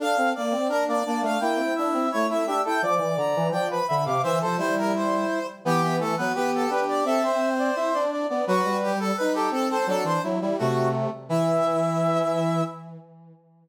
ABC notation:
X:1
M:2/2
L:1/8
Q:1/2=85
K:Dm
V:1 name="Brass Section"
f2 d2 B d d f | g2 e2 ^c e e g | d'2 b2 g =b b d' | e c c B c3 z |
[K:Em] G2 A B B A B d | A c5 z2 | F2 G A B G A c | A c z2 F2 z2 |
e8 |]
V:2 name="Brass Section"
A A z2 D B, D2 | E4 E E G A | d4 d =B e f | c A E5 z |
[K:Em] B, B, A, B, G2 G2 | e3 d e d d d | B3 A B A A A | D2 E E A,3 z |
E8 |]
V:3 name="Brass Section"
D C B, C D2 B, A, | B, C D C A,2 D E | F, E, D, E, F,2 D, C, | E, F, G,4 z2 |
[K:Em] E,3 F, B,2 D2 | C4 E D2 B, | F, G,3 ^D2 C2 | F, E, F, G, C,3 z |
E,8 |]